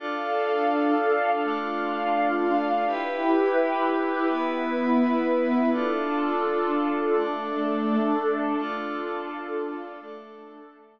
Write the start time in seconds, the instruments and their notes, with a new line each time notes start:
0.00 pad 5 (bowed) D4 F4 A4, pad 2 (warm) D4 A4 F5
1.43 pad 5 (bowed) A3 D4 A4, pad 2 (warm) D4 F4 F5
2.86 pad 2 (warm) E4 G4 B4, pad 5 (bowed) E4 G4 B4
4.28 pad 2 (warm) B3 E4 B4, pad 5 (bowed) B3 E4 B4
5.71 pad 2 (warm) D4 F4 A4, pad 5 (bowed) D4 F4 A4
7.13 pad 2 (warm) A3 D4 A4, pad 5 (bowed) A3 D4 A4
8.58 pad 2 (warm) D4 F4 A4, pad 5 (bowed) D4 F4 A4
10.00 pad 2 (warm) A3 D4 A4, pad 5 (bowed) A3 D4 A4